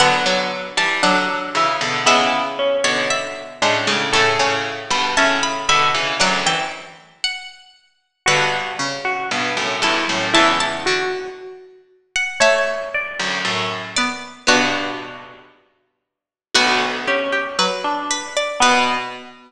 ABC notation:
X:1
M:2/4
L:1/16
Q:1/4=58
K:Bm
V:1 name="Pizzicato Strings"
f3 a f4 | e3 c e4 | c'3 b a b b2 | f g z2 f2 z2 |
B2 z4 A2 | a a z5 f | e2 z4 d2 | F2 z6 |
F4 B2 B d | B4 z4 |]
V:2 name="Pizzicato Strings"
B,3 z D2 E2 | B,2 C4 D2 | A3 z e2 e2 | d2 z6 |
F3 F z2 E2 | E2 F2 z4 | c2 d2 z4 | [DF]4 z4 |
B,2 C2 z D2 z | B,4 z4 |]
V:3 name="Pizzicato Strings"
D, F,3 F, z3 | ^G,6 G, G, | A, C3 C z3 | F, E,5 z2 |
D,2 C,6 | E,2 D,6 | A,6 B,2 | B,4 z4 |
F2 G G F,4 | B,4 z4 |]
V:4 name="Pizzicato Strings" clef=bass
[D,F,] [D,F,]2 [E,G,] [D,F,]2 [C,E,] [B,,D,] | [C,E,]3 [B,,D,]3 [A,,C,] [A,,C,] | [A,,C,] [A,,C,]2 [G,,B,,] [A,,C,]2 [B,,D,] [C,E,] | [D,,F,,]2 z6 |
[G,,B,,]2 z2 [G,,B,,] [F,,A,,] [E,,G,,] [F,,A,,] | [C,,E,,]2 z6 | z3 [D,,F,,] [F,,A,,]4 | [G,,B,,]4 z4 |
[B,,,D,,]8 | B,,4 z4 |]